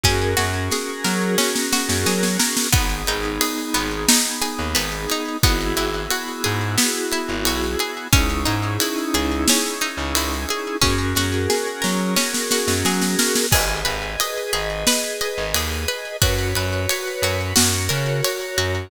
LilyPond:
<<
  \new Staff \with { instrumentName = "Drawbar Organ" } { \time 4/4 \key gis \minor \tempo 4 = 89 <cis' fis' gis' ais'>1 | <b dis' gis'>1 | <b e' fis' gis'>1 | <cis' dis' e' gis'>1 |
<cis' fis' gis' ais'>1 | <gis' b' dis''>1 | <fis' b' cis''>2 <fis' ais' cis''>2 | }
  \new Staff \with { instrumentName = "Pizzicato Strings" } { \time 4/4 \key gis \minor cis'8 fis'8 gis'8 ais'8 cis'8 fis'8 gis'8 ais'8 | b8 dis'8 gis'8 b8 dis'8 gis'8 b8 dis'8 | b8 e'8 fis'8 gis'8 b8 e'8 fis'8 gis'8 | cis'8 dis'8 e'8 gis'8 cis'8 dis'8 e'8 gis'8 |
cis'8 fis'8 gis'8 ais'8 cis'8 fis'8 gis'8 ais'8 | gis'8 b'8 dis''8 gis'8 b'8 dis''8 gis'8 b'8 | fis'8 b'8 cis''8 fis'8 fis'8 ais'8 cis''8 fis'8 | }
  \new Staff \with { instrumentName = "Electric Bass (finger)" } { \clef bass \time 4/4 \key gis \minor fis,8 fis,4 fis4~ fis16 fis,16 fis4 | gis,,8 gis,,4 gis,,4~ gis,,16 dis,16 gis,,4 | gis,,8 gis,,4 gis,4~ gis,16 gis,,16 b,,4 | cis,8 gis,4 cis,4~ cis,16 cis,16 cis,4 |
fis,8 fis,4 fis4~ fis16 fis,16 fis4 | gis,,8 gis,,4 gis,,4~ gis,,16 gis,,16 dis,4 | fis,8 fis,4 fis,8 fis,8 cis4 fis,8 | }
  \new DrumStaff \with { instrumentName = "Drums" } \drummode { \time 4/4 <bd sn>8 sn8 sn8 sn8 sn16 sn16 sn16 sn16 sn16 sn16 sn16 sn16 | <bd cymr>8 cymr8 cymr8 cymr8 sn8 cymr8 cymr8 cymr8 | <bd cymr>8 cymr8 cymr8 cymr8 sn8 cymr8 cymr8 cymr8 | <bd cymr>8 cymr8 cymr8 cymr8 sn8 cymr8 cymr8 cymr8 |
<bd sn>8 sn8 sn8 sn8 sn16 sn16 sn16 sn16 sn16 sn16 sn16 sn16 | <cymc bd>8 cymr8 cymr8 cymr8 sn8 cymr8 cymr8 cymr8 | <bd cymr>8 cymr8 cymr8 cymr8 sn8 cymr8 cymr8 cymr8 | }
>>